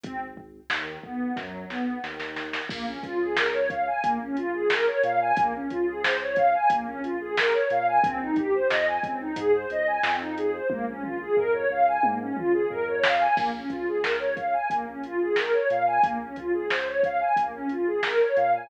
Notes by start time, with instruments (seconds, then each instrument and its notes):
0.03 synth bass 2 G#1, pad 2 (warm) C4, kick, closed hi-hat
0.37 kick
0.70 synth bass 2 D#2, pad 2 (warm) D#3, snare
1.03 synth bass 2 B1, pad 2 (warm) B3, kick
1.36 synth bass 2 F#2, pad 2 (warm) F#3, kick, snare
1.70 synth bass 2 B1, pad 2 (warm) B3, snare
2.03 synth bass 2 D#2, pad 2 (warm) D#3, snare
2.20 snare
2.36 snare
2.53 snare
2.69 synth bass 2 A#1, pad 2 (warm) A#3, kick, crash
2.86 pad 2 (warm) C#4
3.03 synth bass 2 C#2, pad 2 (warm) F4, kick, closed hi-hat
3.20 pad 2 (warm) G#4
3.37 pad 2 (warm) A#4, snare
3.53 pad 2 (warm) C#5
3.70 pad 2 (warm) F5, kick, closed hi-hat
3.87 pad 2 (warm) G#5
4.03 synth bass 2 A#1, pad 2 (warm) A#3, kick, closed hi-hat
4.21 pad 2 (warm) C#4
4.36 pad 2 (warm) F4, closed hi-hat
4.54 pad 2 (warm) G#4
4.70 pad 2 (warm) A#4, snare
4.87 pad 2 (warm) C#5
5.03 synth bass 2 A#2, pad 2 (warm) F5, closed hi-hat
5.21 pad 2 (warm) G#5
5.37 synth bass 2 A#1, pad 2 (warm) A#3, kick, closed hi-hat
5.54 pad 2 (warm) C#4
5.70 synth bass 2 C#2, pad 2 (warm) F4, kick, closed hi-hat
5.87 pad 2 (warm) G#4
6.03 pad 2 (warm) C5, snare
6.20 pad 2 (warm) C#5
6.36 pad 2 (warm) F5, kick, closed hi-hat
6.54 pad 2 (warm) G#5
6.70 synth bass 2 A#1, pad 2 (warm) A#3, kick, closed hi-hat
6.86 pad 2 (warm) C#4
7.03 pad 2 (warm) F4, closed hi-hat
7.20 pad 2 (warm) G#4
7.37 pad 2 (warm) A#4, snare
7.53 pad 2 (warm) C#5
7.70 synth bass 2 A#2, pad 2 (warm) F5, closed hi-hat
7.87 pad 2 (warm) G#5
8.03 synth bass 2 A#1, pad 2 (warm) C4, kick, closed hi-hat
8.20 pad 2 (warm) D#4
8.36 pad 2 (warm) G4, kick, closed hi-hat
8.53 pad 2 (warm) C5
8.70 synth bass 2 F2, pad 2 (warm) D#5, snare
8.87 pad 2 (warm) G#5
9.03 synth bass 2 C#2, pad 2 (warm) C4, kick, closed hi-hat
9.20 pad 2 (warm) D#4
9.36 synth bass 2 G#2, pad 2 (warm) G#4, kick, closed hi-hat
9.53 pad 2 (warm) C5
9.70 synth bass 2 C#2, pad 2 (warm) D#5, closed hi-hat
9.87 pad 2 (warm) G#5
10.03 synth bass 2 F2, pad 2 (warm) C4, snare
10.19 pad 2 (warm) D#4
10.37 pad 2 (warm) G#4, closed hi-hat
10.53 pad 2 (warm) C5
10.70 synth bass 2 A#1, pad 2 (warm) A#3, kick, high tom
10.88 pad 2 (warm) C#4
11.03 pad 2 (warm) F4, mid tom
11.20 pad 2 (warm) G#4
11.37 synth bass 2 F2, pad 2 (warm) A#4, floor tom
11.54 pad 2 (warm) C#5
11.70 synth bass 2 C#2, pad 2 (warm) F5
11.87 pad 2 (warm) G#5
12.03 synth bass 2 G#2, pad 2 (warm) A#3, high tom
12.20 pad 2 (warm) C#4
12.37 synth bass 2 C#2, pad 2 (warm) F4, mid tom
12.53 pad 2 (warm) G#4
12.70 synth bass 2 F2, pad 2 (warm) A#4, floor tom
12.87 pad 2 (warm) C#5
13.03 pad 2 (warm) F5, snare
13.20 pad 2 (warm) G#5
13.36 synth bass 2 A#1, pad 2 (warm) A#3, kick, crash
13.53 pad 2 (warm) C#4
13.70 synth bass 2 C#2, pad 2 (warm) F4, kick, closed hi-hat
13.88 pad 2 (warm) G#4
14.03 pad 2 (warm) A#4, snare
14.19 pad 2 (warm) C#5
14.37 pad 2 (warm) F5, kick, closed hi-hat
14.53 pad 2 (warm) G#5
14.70 synth bass 2 A#1, pad 2 (warm) A#3, kick, closed hi-hat
14.86 pad 2 (warm) C#4
15.03 pad 2 (warm) F4, closed hi-hat
15.21 pad 2 (warm) G#4
15.36 pad 2 (warm) A#4, snare
15.52 pad 2 (warm) C#5
15.70 synth bass 2 A#2, pad 2 (warm) F5, closed hi-hat
15.87 pad 2 (warm) G#5
16.03 synth bass 2 A#1, pad 2 (warm) A#3, kick, closed hi-hat
16.21 pad 2 (warm) C#4
16.36 synth bass 2 C#2, pad 2 (warm) F4, kick, closed hi-hat
16.53 pad 2 (warm) G#4
16.70 pad 2 (warm) C5, snare
16.87 pad 2 (warm) C#5
17.03 pad 2 (warm) F5, kick, closed hi-hat
17.20 pad 2 (warm) G#5
17.36 synth bass 2 A#1, pad 2 (warm) A#3, kick, closed hi-hat
17.54 pad 2 (warm) C#4
17.69 pad 2 (warm) F4, closed hi-hat
17.86 pad 2 (warm) G#4
18.03 pad 2 (warm) A#4, snare
18.21 pad 2 (warm) C#5
18.36 synth bass 2 A#2, pad 2 (warm) F5, closed hi-hat
18.54 pad 2 (warm) G#5